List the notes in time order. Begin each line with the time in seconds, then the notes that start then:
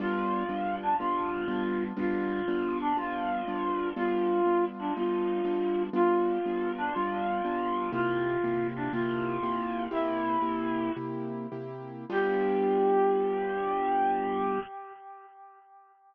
0.00 G3 B3 D4 F4
0.49 G3 B3 D4 F4
0.83 D4
0.99 G3 B3 D4 F4
1.48 G3 B3 D4 F4
1.97 G3 B3 D4 F4
2.48 G3 B3 D4 F4
2.81 D4
2.97 G3 B3 D4 F4
3.47 G3 B3 D4 F4
3.96 G3 B3 D4 F4
4.46 G3 B3 D4 F4
4.79 D4
4.96 G3 B3 D4 F4
5.45 G3 B3 D4 F4
5.93 G3 B3 D4 F4
6.45 G3 B3 D4 F4
6.78 D4
6.94 G3 B3 D4 F4
7.45 G3 B3 D4 F4
7.92 C3 A#3 E4 F4 G4
8.44 C3 A#3 E4 G4
8.76 D4
8.93 C3 A#3 E4 F4 G4
9.43 C3 A#3 E4 G4
9.91 C3 A#3 E4 G4
10.42 C3 A#3 E4 G4
10.97 C3 A#3 E4 G4
11.52 C3 A#3 E4 G4
12.10 G3 B3 D4 F4 G4